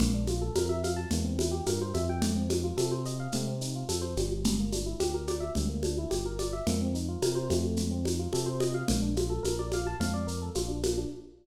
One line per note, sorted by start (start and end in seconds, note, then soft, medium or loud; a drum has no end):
0.00 0.50 A#1 loud
0.00 0.13 A#3 medium
0.00 low conga loud
0.00 shaker medium
0.14 0.27 D4 medium
0.27 0.41 F4 medium
0.27 high conga medium
0.27 shaker medium
0.42 0.54 A4 medium
0.55 1.06 F2 medium
0.55 0.68 A#4 medium
0.55 high conga loud
0.55 shaker medium
0.69 0.82 E5 medium
0.84 0.96 F5 medium
0.84 high conga medium
0.84 shaker medium
0.96 1.09 A5 medium
1.11 1.61 E2 medium
1.11 1.25 A#3 medium
1.11 low conga medium
1.11 shaker medium
1.25 1.37 C4 medium
1.38 1.51 E4 medium
1.38 high conga medium
1.38 shaker medium
1.51 1.64 G4 medium
1.66 1.93 G2 medium
1.66 1.79 A#4 medium
1.66 high conga medium
1.66 shaker medium
1.82 1.94 C5 medium
1.94 2.72 F2 loud
1.94 2.07 E5 medium
1.94 high conga medium
1.94 shaker medium
2.09 2.22 G5 medium
2.22 2.34 A3 medium
2.22 low conga loud
2.22 shaker medium
2.36 2.48 C4 medium
2.50 2.62 D#4 medium
2.50 high conga medium
2.50 shaker medium
2.63 2.76 F4 medium
2.77 3.28 C3 medium
2.77 2.90 A4 medium
2.77 high conga medium
2.77 shaker medium
2.91 3.04 C5 medium
3.05 3.18 D#5 medium
3.05 shaker medium
3.20 3.32 F5 medium
3.32 3.83 C3 medium
3.32 3.47 A3 medium
3.32 low conga medium
3.32 shaker medium
3.47 3.60 C4 medium
3.61 3.73 D#4 medium
3.61 shaker medium
3.75 3.88 F4 medium
3.89 4.15 F2 medium
3.89 4.01 A4 medium
3.89 high conga medium
3.89 shaker medium
4.02 4.14 C5 medium
4.17 4.94 G1 medium
4.17 4.58 G3 medium
4.17 high conga medium
4.17 shaker medium
4.44 low conga loud
4.44 shaker medium
4.59 4.72 A#3 medium
4.72 4.85 D4 medium
4.72 high conga medium
4.72 shaker medium
4.86 4.99 E4 medium
5.00 5.50 D2 medium
5.00 5.12 G4 medium
5.00 high conga medium
5.00 shaker medium
5.14 5.27 A#4 medium
5.27 5.40 D5 medium
5.27 high conga medium
5.27 shaker medium
5.40 5.53 E5 medium
5.55 6.06 D2 medium
5.55 5.68 G3 medium
5.55 low conga medium
5.55 shaker medium
5.69 5.82 A#3 medium
5.83 5.96 D4 medium
5.83 high conga medium
5.83 shaker medium
5.98 6.11 E4 medium
6.10 6.61 G1 medium
6.10 6.23 G4 medium
6.10 high conga medium
6.10 shaker medium
6.26 6.38 A#4 medium
6.39 6.51 D5 medium
6.39 high conga medium
6.39 shaker medium
6.53 6.65 E5 medium
6.67 7.17 F2 medium
6.67 6.79 A#3 medium
6.67 low conga loud
6.67 shaker medium
6.81 6.94 C4 medium
6.94 7.07 D#4 medium
6.94 shaker medium
7.08 7.21 F4 medium
7.22 7.49 C3 medium
7.22 7.35 A#4 medium
7.22 high conga medium
7.22 shaker medium
7.35 7.48 C5 medium
7.50 8.28 F2 loud
7.50 7.90 A3 medium
7.50 high conga medium
7.50 shaker medium
7.77 low conga medium
7.77 shaker medium
7.91 8.03 C4 medium
8.05 8.18 D#4 medium
8.05 high conga medium
8.05 shaker medium
8.19 8.32 F4 medium
8.33 8.83 C3 medium
8.33 8.46 A4 medium
8.33 high conga medium
8.33 shaker medium
8.46 8.59 C5 medium
8.60 8.73 D#5 medium
8.60 high conga medium
8.60 shaker medium
8.74 8.87 F5 medium
8.88 9.39 A#1 loud
8.88 9.01 A#3 medium
8.88 low conga loud
8.88 shaker medium
9.02 9.15 D4 medium
9.16 9.29 F4 medium
9.16 high conga medium
9.16 shaker medium
9.30 9.42 A4 medium
9.43 9.94 A#1 medium
9.43 9.56 A#4 medium
9.43 high conga medium
9.43 shaker medium
9.59 9.71 D5 medium
9.72 9.86 F5 medium
9.72 high conga medium
9.72 shaker medium
9.87 9.99 A5 medium
10.00 10.50 F2 medium
10.00 10.13 F5 medium
10.00 low conga loud
10.00 shaker medium
10.14 10.26 D5 medium
10.27 10.39 A#4 medium
10.27 shaker medium
10.42 10.54 A4 medium
10.55 11.05 A#1 medium
10.55 10.68 F4 medium
10.55 high conga medium
10.55 shaker medium
10.68 10.81 D4 medium
10.83 10.96 A#3 medium
10.83 high conga medium
10.83 shaker medium
10.98 11.10 D4 medium